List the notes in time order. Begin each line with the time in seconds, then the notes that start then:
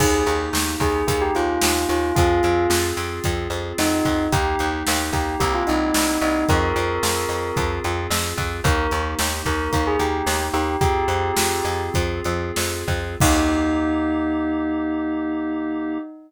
0.00 D#2 A#3 D#4 G4 G#4, kick, crash
0.26 D#2, closed hi-hat
0.53 D#2, snare
0.80 D#2 G#4, kick, closed hi-hat
1.08 D#2 G#4, kick, closed hi-hat
1.22 G4
1.35 D#2 F4, closed hi-hat
1.61 D#2, snare
1.89 D#2 F4, closed hi-hat
2.16 F2 C4 F4 G#4, kick, closed hi-hat
2.43 F2, closed hi-hat
2.70 F2, snare
2.97 F2, closed hi-hat
3.24 F2, kick, closed hi-hat
3.50 F2, closed hi-hat
3.78 F2 D#4, snare
4.05 F2, kick, closed hi-hat
4.32 D#2 A#3 D#4 G4, kick, closed hi-hat
4.59 D#2, closed hi-hat
4.87 D#2, snare
5.13 D#2 G4, kick, closed hi-hat
5.40 C2 A#3 C4 E4 G4, kick, closed hi-hat
5.54 F4
5.67 C2 D#4, closed hi-hat
5.94 C2, snare
6.21 C2 D#4, closed hi-hat
6.49 F2 C4 F4 G#4 A#4, kick, closed hi-hat
6.76 F2, closed hi-hat
7.03 F2, snare
7.29 F2, closed hi-hat
7.56 F2, kick, closed hi-hat
7.84 F2, closed hi-hat
8.10 F2, snare
8.38 F2, kick, closed hi-hat
8.64 D#2 A#3 D#4 G4 A#4, kick, closed hi-hat
8.91 D#2, closed hi-hat
9.19 D#2, snare
9.45 D#2 A#4, kick, closed hi-hat
9.73 D#2 A#4, kick, closed hi-hat
9.87 G#4
9.99 D#2 G4, closed hi-hat
10.26 D#2, snare
10.53 D#2 G4, closed hi-hat
10.81 F2 C4 F4 G4 G#4, kick, closed hi-hat
11.08 F2, closed hi-hat
11.37 F2, snare
11.65 F2, closed hi-hat
11.94 F2, kick, closed hi-hat
12.24 F2, closed hi-hat
12.56 F2, snare
12.88 F2, kick, closed hi-hat
13.20 D#2 A#3 D#4 G4, kick, crash